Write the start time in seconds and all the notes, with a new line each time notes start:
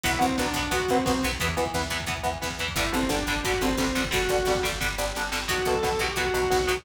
0.03 B1 F#3 B3 E4, kick, closed hi-hat
0.12 kick
0.19 B1 F#3 B3 C4, kick, closed hi-hat
0.29 kick
0.37 B1 F#3 B3 D4, kick, snare
0.46 kick
0.54 B1 F#3 B3, kick, closed hi-hat
0.63 kick
0.71 B1 F#3 B3 F#4, kick, closed hi-hat
0.80 kick
0.88 B1 F#3 B3 C4, kick, closed hi-hat
0.98 kick
1.05 B1 F#3 B3 C4, kick, snare
1.14 kick
1.22 B1 F#3 B3, kick, closed hi-hat
1.32 kick
1.40 E2 E3 B3, kick, closed hi-hat
1.48 kick
1.57 E2 E3 B3, kick, closed hi-hat
1.66 kick
1.74 E2 E3 B3, kick, snare
1.83 kick
1.90 E2 E3 B3, kick, closed hi-hat
2.00 kick
2.06 E2 E3 B3, kick, closed hi-hat
2.17 kick
2.23 E2 E3 B3, kick, closed hi-hat
2.34 kick
2.42 E2 E3 B3, kick, snare
2.50 kick
2.59 E2 E3 B3, kick, closed hi-hat
2.68 kick
2.76 G1 D3 G3 E4, kick, closed hi-hat
2.86 kick
2.92 G1 D3 G3 C4, kick, closed hi-hat
3.02 kick
3.09 G1 D3 G3 D4, kick, snare
3.19 kick
3.27 G1 D3 G3, kick, closed hi-hat
3.36 kick
3.44 G1 D3 G3 F#4, kick, closed hi-hat
3.54 kick
3.61 G1 D3 G3 C4, kick, closed hi-hat
3.70 kick
3.77 G1 D3 G3 C4, kick, snare
3.87 kick
3.95 G1 D3 G3, kick, closed hi-hat
4.04 kick
4.11 G1 D3 G3 F#4, kick, closed hi-hat
4.21 kick
4.29 G1 D3 G3, kick, closed hi-hat
4.38 kick
4.45 G1 D3 G3, kick, snare
4.55 kick
4.63 G1 D3 G3, kick, closed hi-hat
4.72 kick
4.80 G1 D3 G3, kick, snare
4.98 G1 D3 G3, snare
5.15 G1 D3 G3, snare
5.32 G1 D3 G3, snare
5.48 B1 B2 F#3 F#4, kick, closed hi-hat
5.58 kick
5.65 B1 B2 F#3 A4, kick, closed hi-hat
5.74 kick
5.83 B1 B2 F#3, kick, snare
5.92 kick
5.99 B1 B2 F#3 G4, kick, closed hi-hat
6.09 kick
6.16 B1 B2 F#3 F#4, kick, closed hi-hat
6.26 kick
6.34 B1 B2 F#3, kick, closed hi-hat
6.43 kick
6.50 B1 B2 F#3, kick, snare
6.60 kick
6.67 B1 B2 F#3, kick, closed hi-hat
6.77 kick